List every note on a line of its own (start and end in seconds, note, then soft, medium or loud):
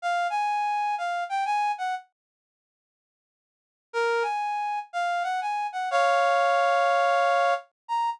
0.02 0.27 F5 loud
0.30 0.95 G#5 loud
0.98 1.24 F5 medium
1.29 1.44 G5 medium
1.45 1.72 G#5 loud
1.78 1.95 F#5 medium
3.93 4.23 A#4 loud
4.22 4.79 G#5 medium
4.93 5.23 F5 medium
5.23 5.40 F#5 medium
5.41 5.67 G#5 medium
5.73 5.89 F#5 medium
5.91 7.54 C#5 loud
5.91 7.54 F5 loud
7.88 8.10 A#5 loud